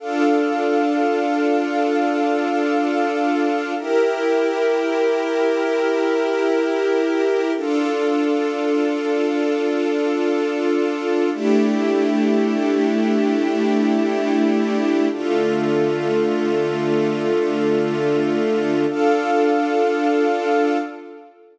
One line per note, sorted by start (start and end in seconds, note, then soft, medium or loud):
0.00 3.74 D4 loud
0.00 3.74 D4 medium
0.00 3.74 F4 medium
0.00 3.74 A4 medium
0.00 3.74 F5 medium
3.78 7.52 E4 medium
3.78 7.52 E4 loud
3.78 7.52 G4 medium
3.78 7.52 A#4 medium
3.78 7.52 A#4 loud
7.56 11.30 D4 medium
7.56 11.30 F4 medium
7.56 11.30 F4 loud
7.56 11.30 A4 medium
11.34 15.08 A3 medium
11.34 15.08 A3 loud
11.34 15.08 D4 medium
11.34 15.08 D4 loud
11.34 15.08 E4 medium
11.34 15.08 E4 loud
11.34 15.08 G4 medium
15.12 18.86 D3 medium
15.12 18.86 A3 medium
15.12 18.86 D4 medium
15.12 18.86 F4 loud
15.12 18.86 F4 medium
15.12 18.86 A4 medium
18.90 20.78 D4 loud
18.90 20.78 F4 loud
18.90 20.78 A4 loud
18.90 20.78 F5 loud